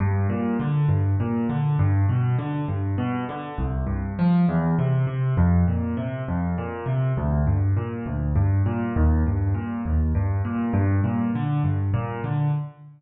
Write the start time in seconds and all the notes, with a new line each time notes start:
0.00 G2
0.29 A#2
0.60 D3
0.89 G2
1.20 A#2
1.49 D3
1.79 G2
2.09 B2
2.38 D3
2.68 G2
2.98 B2
3.29 D3
3.58 C2
3.87 G2
4.19 F3
4.49 E2
4.78 C3
5.07 C3
5.37 F2
5.67 A#2
5.97 C3
6.28 F2
6.58 A#2
6.86 C3
7.17 D2
7.47 G2
7.77 A#2
8.06 D2
8.36 G2
8.66 A#2
8.96 D#2
9.26 G2
9.54 A#2
9.86 D#2
10.15 G2
10.45 A#2
10.73 G2
11.04 A#2
11.35 D3
11.64 G2
11.94 A#2
12.24 D3